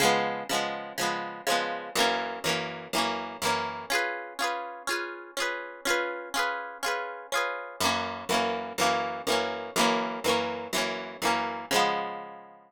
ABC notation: X:1
M:4/4
L:1/8
Q:1/4=123
K:Db
V:1 name="Acoustic Guitar (steel)"
[D,F,A,_C]2 [D,F,A,C]2 [D,F,A,C]2 [D,F,A,C]2 | [G,,_F,B,D]2 [G,,F,B,D]2 [G,,F,B,D]2 [G,,F,B,D]2 | [DFA_c]2 [DFAc]2 [DFAc]2 [DFAc]2 | [DFA_c]2 [DFAc]2 [DFAc]2 [DFAc]2 |
[G,,_F,B,D]2 [G,,F,B,D]2 [G,,F,B,D]2 [G,,F,B,D]2 | [G,,_F,B,D]2 [G,,F,B,D]2 [G,,F,B,D]2 [G,,F,B,D]2 | [D,F,A,_C]8 |]